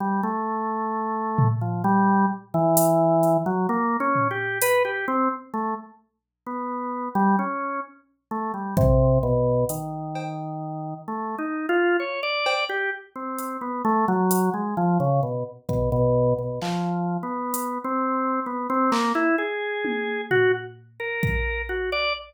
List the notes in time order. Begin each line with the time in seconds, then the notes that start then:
0.00 G3
0.23 A3
1.38 floor tom
1.61 F3
1.84 G3
2.54 E3
2.77 closed hi-hat
3.23 closed hi-hat
3.46 F#3
3.69 A#3
4.00 C#4
4.15 floor tom
4.31 G4
4.62 B4, closed hi-hat
4.85 G4
5.08 C4
5.54 A3
6.47 B3
7.15 G3
7.39 C#4
8.31 A3
8.54 G3
8.77 C3, kick
9.23 B2
9.69 D#3, closed hi-hat
10.15 cowbell
11.08 A3
11.38 D#4
11.69 F4
12.00 C#5
12.23 D5
12.46 cowbell
12.69 G4
13.16 C4
13.38 closed hi-hat
13.61 B3
13.85 A3
14.08 F#3
14.31 closed hi-hat
14.54 G#3
14.77 F3
15.00 C#3
15.23 B2
15.69 B2, kick
15.92 B2
16.38 B2
16.62 F3, clap
17.23 B3
17.54 closed hi-hat
17.84 C4
18.46 B3
18.70 C4
18.92 A#3, clap
19.15 E4
19.38 G#4
19.85 high tom
20.31 F#4, floor tom
21.00 A#4
21.23 kick
21.69 F#4
21.92 D5